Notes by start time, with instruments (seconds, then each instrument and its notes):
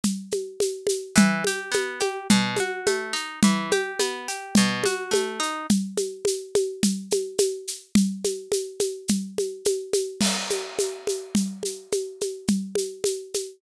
0.04 low conga, shaker
0.31 high conga, shaker
0.60 high conga, shaker
0.87 high conga, shaker
1.16 orchestral harp E3, low conga, shaker
1.44 orchestral harp G4, high conga, shaker
1.72 orchestral harp B3, high conga, shaker
2.00 orchestral harp G4, high conga, shaker
2.30 orchestral harp B2, low conga, shaker
2.57 orchestral harp F#4, high conga, shaker
2.86 orchestral harp A3, high conga, shaker
3.13 orchestral harp D#4, shaker
3.43 orchestral harp E3, low conga, shaker
3.71 orchestral harp G4, high conga, shaker
4.00 orchestral harp B3, high conga, shaker
4.28 orchestral harp G4, shaker
4.55 orchestral harp B2, low conga, shaker
4.84 orchestral harp F#4, high conga, shaker
5.11 orchestral harp A3, high conga, shaker
5.40 orchestral harp D#4, shaker
5.70 low conga, shaker
5.97 high conga, shaker
6.25 high conga, shaker
6.55 high conga, shaker
6.83 low conga, shaker
7.11 high conga, shaker
7.38 high conga, shaker
7.68 shaker
7.95 low conga, shaker
8.24 high conga, shaker
8.52 high conga, shaker
8.80 high conga, shaker
9.08 low conga, shaker
9.38 high conga, shaker
9.65 high conga, shaker
9.93 high conga, shaker
10.21 crash, low conga, shaker
10.50 high conga, shaker
10.79 high conga, shaker
11.07 high conga, shaker
11.35 low conga, shaker
11.63 high conga, shaker
11.92 high conga, shaker
12.21 high conga, shaker
12.48 low conga, shaker
12.75 high conga, shaker
13.04 high conga, shaker
13.34 high conga, shaker